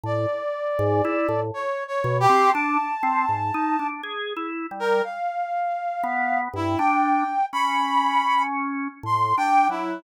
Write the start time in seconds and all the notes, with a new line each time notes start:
0.04 A2 D5
0.79 G#2
1.05 E4
1.29 A2
1.54 C#5
1.88 C#5
2.04 B2
2.20 G4
2.29 C4
2.52 D4 A5
3.03 C4
3.29 G#2
3.54 D#4
3.79 D4
4.03 G#4
4.36 E4
4.71 G3
4.80 A#4
5.04 F5
6.04 B3
6.53 G2 E4
6.78 D4 G5
7.53 C#4 B5
9.03 A2 C6
9.37 D4 G5
9.69 F#3 E4